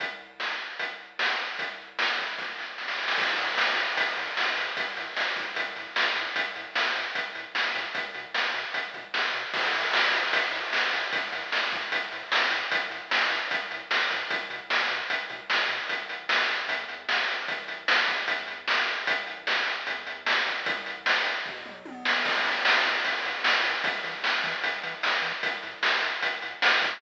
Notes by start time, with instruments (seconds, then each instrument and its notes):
0.00 kick, closed hi-hat
0.40 snare
0.79 kick, closed hi-hat
1.19 snare
1.59 kick, closed hi-hat
1.99 snare
2.19 kick
2.38 kick, snare
2.58 snare
2.78 snare
2.88 snare
2.98 snare
3.08 snare
3.17 synth bass 1 A1, kick, crash
3.38 synth bass 1 A2, closed hi-hat
3.58 synth bass 1 A1, snare
3.76 synth bass 1 A2, closed hi-hat
3.97 synth bass 1 A1, kick, closed hi-hat
4.17 synth bass 1 A2, closed hi-hat
4.36 synth bass 1 A1, snare
4.57 synth bass 1 A2, closed hi-hat
4.77 synth bass 1 A1, kick, closed hi-hat
4.97 synth bass 1 A2, closed hi-hat
5.15 synth bass 1 A1, snare
5.36 synth bass 1 A2, kick, closed hi-hat
5.56 synth bass 1 A1, kick, closed hi-hat
5.76 synth bass 1 A2, closed hi-hat
5.96 synth bass 1 A1, snare
6.16 synth bass 1 A2, closed hi-hat
6.35 synth bass 1 A1, kick, closed hi-hat
6.56 synth bass 1 A2, closed hi-hat
6.75 synth bass 1 A1, snare
6.95 synth bass 1 A2, closed hi-hat
7.14 synth bass 1 A1, kick, closed hi-hat
7.35 synth bass 1 A2, closed hi-hat
7.54 synth bass 1 A1, snare
7.75 synth bass 1 A2, kick, closed hi-hat
7.95 synth bass 1 B1, kick, closed hi-hat
8.14 synth bass 1 B2, closed hi-hat
8.35 synth bass 1 B1, snare
8.54 synth bass 1 B2, closed hi-hat
8.74 synth bass 1 B1, kick, closed hi-hat
8.94 synth bass 1 B2, kick, closed hi-hat
9.14 synth bass 1 B1, snare
9.34 synth bass 1 B2, closed hi-hat
9.53 synth bass 1 A1, kick, crash
9.74 synth bass 1 A2, closed hi-hat
9.93 synth bass 1 A1, snare
10.13 synth bass 1 A2, closed hi-hat
10.33 synth bass 1 A1, kick, closed hi-hat
10.52 synth bass 1 A2, closed hi-hat
10.73 synth bass 1 A1, snare
10.93 synth bass 1 A2, closed hi-hat
11.12 synth bass 1 A1, kick, closed hi-hat
11.32 synth bass 1 A2, closed hi-hat
11.52 synth bass 1 A1, snare
11.72 synth bass 1 A2, kick, closed hi-hat
11.91 synth bass 1 A1, kick, closed hi-hat
12.12 synth bass 1 A2, closed hi-hat
12.32 synth bass 1 A1, snare
12.52 synth bass 1 A2, closed hi-hat
12.71 synth bass 1 A1, kick, closed hi-hat
12.90 synth bass 1 A2, closed hi-hat
13.11 synth bass 1 A1, snare
13.30 synth bass 1 A2, closed hi-hat
13.51 synth bass 1 A1, kick, closed hi-hat
13.71 synth bass 1 A2, closed hi-hat
13.90 synth bass 1 A1, snare
14.11 synth bass 1 A2, kick, closed hi-hat
14.30 synth bass 1 B1, kick, closed hi-hat
14.50 synth bass 1 B2, closed hi-hat
14.70 synth bass 1 B1, snare
14.90 synth bass 1 B2, closed hi-hat
15.09 synth bass 1 B1, kick, closed hi-hat
15.30 synth bass 1 B2, kick, closed hi-hat
15.50 synth bass 1 B1, snare
15.69 synth bass 1 B2, closed hi-hat
15.89 synth bass 1 A1, kick, closed hi-hat
16.09 synth bass 1 A1, closed hi-hat
16.29 synth bass 1 A1, snare
16.49 synth bass 1 A1, closed hi-hat
16.68 synth bass 1 E2, kick, closed hi-hat
16.89 synth bass 1 E2, closed hi-hat
17.09 synth bass 1 E2, snare
17.28 synth bass 1 E2, closed hi-hat
17.48 synth bass 1 A1, kick, closed hi-hat
17.68 synth bass 1 A1, closed hi-hat
17.88 synth bass 1 A1, snare
18.08 synth bass 1 E2, kick, closed hi-hat
18.28 kick, closed hi-hat
18.48 synth bass 1 E2, closed hi-hat
18.68 synth bass 1 E2, snare
18.87 synth bass 1 E2, closed hi-hat
19.07 synth bass 1 A1, kick, closed hi-hat
19.27 synth bass 1 A1, closed hi-hat
19.47 synth bass 1 A1, snare
19.66 synth bass 1 A1, closed hi-hat
19.87 synth bass 1 E2, kick, closed hi-hat
20.06 synth bass 1 E2, closed hi-hat
20.25 synth bass 1 E2, snare
20.46 synth bass 1 A1, kick, closed hi-hat
20.66 kick, closed hi-hat
20.85 synth bass 1 A1, closed hi-hat
21.06 synth bass 1 A1, snare
21.25 synth bass 1 A1, closed hi-hat
21.46 synth bass 1 E2, kick, floor tom
21.66 synth bass 1 E2, mid tom
21.85 synth bass 1 E2, high tom
22.05 synth bass 1 E2, snare
22.25 synth bass 1 A1, kick, crash
22.44 synth bass 1 A2, closed hi-hat
22.65 synth bass 1 A1, snare
22.85 synth bass 1 A2, closed hi-hat
23.04 synth bass 1 A1, kick, closed hi-hat
23.24 synth bass 1 A2, closed hi-hat
23.44 synth bass 1 A1, snare
23.64 synth bass 1 A2, closed hi-hat
23.84 synth bass 1 E2, kick, closed hi-hat
24.04 synth bass 1 E3, closed hi-hat
24.23 synth bass 1 E2, snare
24.44 synth bass 1 E3, kick, closed hi-hat
24.63 synth bass 1 E2, kick, closed hi-hat
24.83 synth bass 1 E3, closed hi-hat
25.03 synth bass 1 E2, snare
25.22 synth bass 1 E3, closed hi-hat
25.43 synth bass 1 A1, kick, closed hi-hat
25.63 synth bass 1 A2, closed hi-hat
25.83 synth bass 1 A1, snare
26.01 synth bass 1 A2, closed hi-hat
26.22 synth bass 1 A1, kick, closed hi-hat
26.42 synth bass 1 A2, closed hi-hat
26.62 synth bass 1 A1, snare
26.82 synth bass 1 A2, kick, closed hi-hat